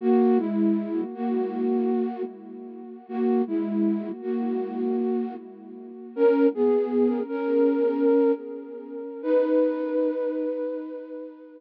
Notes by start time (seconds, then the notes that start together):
0.01 A#3 F#4
0.38 G#3 E4
1.15 A#3 F#4
3.09 A#3 F#4
3.47 G#3 E4
4.22 A#3 F#4
6.16 C#4 A#4
6.54 B3 G#4
7.29 C#4 A#4
9.23 D#4 B4